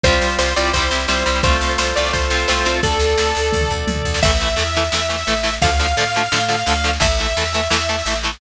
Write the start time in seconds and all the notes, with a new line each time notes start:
0.03 C2 G3 C4 F4 G4 C5, kick, snare
0.12 snare
0.21 C2, snare
0.30 snare
0.39 C2 C5, snare
0.48 snare
0.56 C2 G3 C4 E4 F4 G4 C5 D5, snare
0.65 snare
0.73 C2 G3 C4 E4 C5, kick, snare
0.82 snare
0.91 C2 G3 C4 E4, snare
1.00 snare
1.08 C2 G3 C4 E4 C5, snare
1.17 snare
1.26 C2 G3 C4 E4, snare
1.35 snare
1.43 C2 A3 C4 F4 A4 C5, kick, snare
1.52 snare
1.61 C2, snare
1.69 snare
1.78 C2 C5, snare
1.87 snare
1.95 C2 A3 C4 F4 D5, snare
2.05 snare
2.13 C2 C5, kick, snare
2.22 snare
2.30 C2 A3 C4 F4, snare
2.40 snare
2.48 C2 A3 C4 F4 C5, snare
2.57 snare
2.65 C2 A3 C4 F4, snare
2.74 snare
2.83 D2 A4 D5, kick, snare
2.92 snare
2.99 D2, snare
3.09 snare
3.18 D2, snare
3.27 snare
3.35 D2, snare
3.45 snare
3.52 D2, kick, high tom
3.61 mid tom
3.70 D2, floor tom
3.87 D2, high tom
3.96 mid tom
4.04 D2, floor tom
4.14 snare
4.22 A1 E3 A3 E5, kick, snare, crash
4.32 snare
4.40 E3 A3, snare
4.49 snare
4.56 E2 E3 A3, snare
4.66 snare
4.75 E3 A3, snare
4.84 snare
4.92 E2 E3 A3, snare
5.01 snare
5.09 E3 A3, snare
5.18 snare
5.27 A1 E3 A3, snare
5.37 snare
5.43 E3 A3, snare
5.53 snare
5.62 D2 D3 F3 A3 F5, kick, snare
5.70 snare
5.79 D3 F3 A3, snare
5.88 snare
5.97 A2 D3 F3 A3, snare
6.05 snare
6.14 D3 F3 A3, snare
6.23 snare
6.32 A2 D3 F3 A3, snare
6.40 snare
6.48 D3 F3 A3, snare
6.58 snare
6.66 D2 D3 F3 A3, snare
6.76 snare
6.84 D3 F3 A3, snare
6.93 snare
7.00 A1 E3 A3 E5, kick, snare
7.10 snare
7.18 E3 A3, snare
7.28 snare
7.37 E2 E3 A3, snare
7.46 snare
7.54 E3 A3, snare
7.62 snare
7.70 E2 E3 A3, snare
7.81 snare
7.89 E3 A3, snare
7.98 snare
8.06 A1 E3 A3, snare
8.15 snare
8.23 E3 A3, snare
8.32 snare